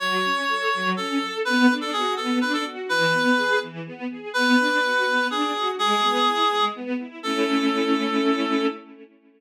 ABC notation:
X:1
M:6/8
L:1/16
Q:3/8=83
K:A
V:1 name="Clarinet"
c8 A4 | B3 A G2 A2 B A z2 | B6 z6 | B8 G4 |
G8 z4 | A12 |]
V:2 name="String Ensemble 1"
F,2 C2 A2 F,2 C2 A2 | B,2 D2 F2 B,2 D2 F2 | E,2 B,2 G2 E,2 B,2 G2 | B,2 D2 F2 B,2 D2 F2 |
G,2 B,2 E2 G,2 B,2 E2 | [A,CE]12 |]